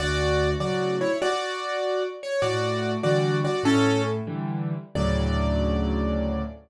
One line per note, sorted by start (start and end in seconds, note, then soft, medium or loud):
0.00 0.55 D2 loud
0.00 0.50 F#4 loud
0.00 0.50 D5 loud
0.60 1.03 A2 medium
0.60 1.03 C#3 medium
0.60 1.03 F#3 medium
0.60 0.96 F#4 medium
0.60 0.96 D5 medium
1.01 1.17 E4 medium
1.01 1.17 C#5 medium
1.22 2.03 F#4 loud
1.22 2.03 D5 loud
2.23 2.43 C#5 medium
2.42 2.97 A2 medium
2.42 2.91 F#4 loud
2.42 2.91 D5 loud
3.03 3.45 D3 medium
3.03 3.45 E3 medium
3.03 3.45 G3 medium
3.03 3.37 F#4 medium
3.03 3.37 D5 loud
3.44 3.63 F#4 medium
3.44 3.63 D5 medium
3.63 4.20 A2 loud
3.63 4.02 C#4 loud
3.63 4.02 A4 loud
4.27 4.74 D3 medium
4.27 4.74 E3 medium
4.27 4.74 G3 medium
4.95 6.42 D2 medium
4.95 6.42 A2 loud
4.95 6.42 C#3 medium
4.95 6.42 F#3 loud
4.95 6.42 D5 loud